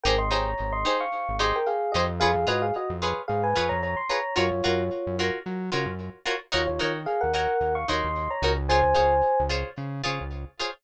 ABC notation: X:1
M:4/4
L:1/16
Q:"Swing 16ths" 1/4=111
K:Ebdor
V:1 name="Electric Piano 1"
[B=g] [ec'] [db]3 [ec']2 [fd']3 [ec'] [Bg] [Af]2 [=Ge] z | [Af]2 [Ge] [Af] [Ge] z3 [Af] [_ca]2 [db] [db] =c' [db]2 | [Fd]6 z10 | [Fd] [Fd]2 z [Af] [Bg] [Bg]3 [fd'] [ec']3 [db]2 z |
[ca]6 z10 |]
V:2 name="Pizzicato Strings"
[E=GAc]2 [EGAc]4 [EGAc]4 [EGAc]4 [EGAc]2 | [FA_cd]2 [FAcd]4 [FAcd]4 [FAcd]4 [FAcd]2 | [FGBd]2 [FGBd]4 [FGBd]4 [FGBd]4 [FGBd]2 | [EGBd]2 [EGBd]4 [EGBd]4 [EGBd]4 [EGBd]2 |
[FAcd]2 [FAcd]4 [FAcd]4 [FAcd]4 [FAcd]2 |]
V:3 name="Synth Bass 1" clef=bass
A,,,2 A,,,2 A,,,5 A,,,5 F,,2- | F,, F,, A,,3 F,,3 A,,2 F,, F,,5 | G,, G,, G,,3 G,,3 G,2 D, G,,5 | E,, E,, E,3 E,,3 E,,2 E,, E,,3 D,,2- |
D,, D,, D,,3 D,,3 D,2 D, D,,5 |]